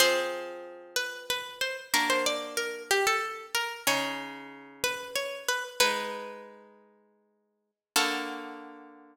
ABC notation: X:1
M:3/4
L:1/16
Q:1/4=93
K:Ador
V:1 name="Pizzicato Strings"
c6 B2 B2 c z | _B c d2 B2 G A3 B2 | ^c6 B2 c2 B z | "^rit." B8 z4 |
A12 |]
V:2 name="Acoustic Guitar (steel)"
[=F,C_A]12 | [_B,DF]12 | [^C,^D^G]12 | "^rit." [^G,^DB]12 |
[D,^A,F]12 |]